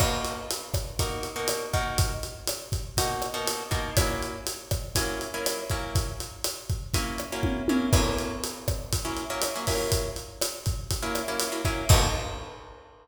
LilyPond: <<
  \new Staff \with { instrumentName = "Acoustic Guitar (steel)" } { \time 4/4 \key b \major \tempo 4 = 121 <b, ais dis' fis'>2 <b, ais dis' fis'>8. <b, ais dis' fis'>8. <b, ais dis' fis'>8~ | <b, ais dis' fis'>2 <b, ais dis' fis'>8. <b, ais dis' fis'>8. <b, ais dis' fis'>8 | <fis ais cis' e'>2 <fis ais cis' e'>8. <fis ais cis' e'>8. <fis ais cis' e'>8~ | <fis ais cis' e'>2 <fis ais cis' e'>8. <fis ais cis' e'>8. <fis ais cis' e'>8 |
<fis ais cis' e'>2~ <fis ais cis' e'>16 <fis ais cis' e'>8 <fis ais cis' e'>8 <fis ais cis' e'>16 <fis ais cis' e'>8~ | <fis ais cis' e'>2~ <fis ais cis' e'>16 <fis ais cis' e'>8 <fis ais cis' e'>8 <fis ais cis' e'>16 <fis ais cis' e'>8 | <b, ais dis' fis'>4 r2. | }
  \new DrumStaff \with { instrumentName = "Drums" } \drummode { \time 4/4 <cymc bd ss>8 hh8 hh8 <hh bd ss>8 <hh bd>8 hh8 <hh ss>8 <hh bd>8 | <hh bd>8 hh8 <hh ss>8 <hh bd>8 <hh bd>8 <hh ss>8 hh8 <hh bd>8 | <hh bd ss>8 hh8 hh8 <hh bd ss>8 <hh bd>8 hh8 <hh ss>8 <hh bd>8 | <hh bd>8 hh8 <hh ss>8 <hh bd>8 <hh bd>8 <hh ss>8 <bd tommh>8 tommh8 |
<cymc bd ss>8 hh8 hh8 <hh bd ss>8 <hh bd>8 hh8 <hh ss>8 <hho bd>8 | <hh bd>8 hh8 <hh ss>8 <hh bd>8 <hh bd>8 <hh ss>8 hh8 <hh bd>8 | <cymc bd>4 r4 r4 r4 | }
>>